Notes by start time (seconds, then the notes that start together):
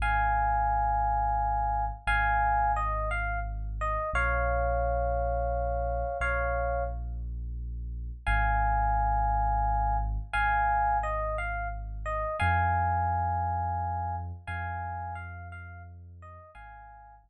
0.00 G#1 F5 G#5
2.07 G#1 F5 G#5
2.76 D#5
3.11 F5
3.81 D#5
4.13 A#1 C#5 F5
6.20 A#1 C#5 F5
8.27 G#1 F5 G#5
10.33 G#1 F5 G#5
11.03 D#5
11.38 F5
12.06 D#5
12.40 F2 F5 G#5
14.47 F2 F5 G#5
15.15 F5
15.52 F5
16.22 D#5
16.55 G#1 F5 G#5
17.24 G#1